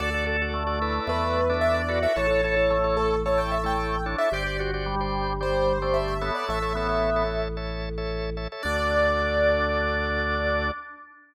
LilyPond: <<
  \new Staff \with { instrumentName = "Acoustic Grand Piano" } { \time 4/4 \key d \major \tempo 4 = 111 d''8 r4. b'4 e''16 d''8 e''16 | cis''4. a'8 cis''16 g''16 e''16 g''8. r16 e''16 | d''8 r4. c''4 e''16 e''8 d''16 | e''2 r2 |
d''1 | }
  \new Staff \with { instrumentName = "Drawbar Organ" } { \time 4/4 \key d \major a'8 a'8 a4 a8. d'8. fis'8 | a'8 a'8 a4 a8. a8. d'8 | g'8 fis'8 g4 g8. a8. b8 | a8 b4 r2 r8 |
d'1 | }
  \new Staff \with { instrumentName = "Drawbar Organ" } { \time 4/4 \key d \major <fis' a' d''>16 <fis' a' d''>16 <fis' a' d''>16 <fis' a' d''>8 <fis' a' d''>16 <e' a' b' d''>4~ <e' a' b' d''>16 <e' a' b' d''>8. <e' a' b' d''>16 <e' a' b' d''>16 | <e' a' cis''>16 <e' a' cis''>16 <e' a' cis''>16 <e' a' cis''>8 <e' a' cis''>8. <e' a' cis''>8. <e' a' cis''>8. <e' a' cis''>16 <e' a' cis''>16 | <g' c'' d''>16 <g' c'' d''>16 <g' c'' d''>16 <g' c'' d''>8 <g' c'' d''>8. <g' c'' d''>8. <g' c'' d''>8. <a' cis'' e''>8~ | <a' cis'' e''>16 <a' cis'' e''>16 <a' cis'' e''>16 <a' cis'' e''>8 <a' cis'' e''>8. <a' cis'' e''>8. <a' cis'' e''>8. <a' cis'' e''>16 <a' cis'' e''>16 |
<fis' a' d''>1 | }
  \new Staff \with { instrumentName = "Drawbar Organ" } { \clef bass \time 4/4 \key d \major d,2 e,2 | a,,1 | g,,1 | a,,1 |
d,1 | }
>>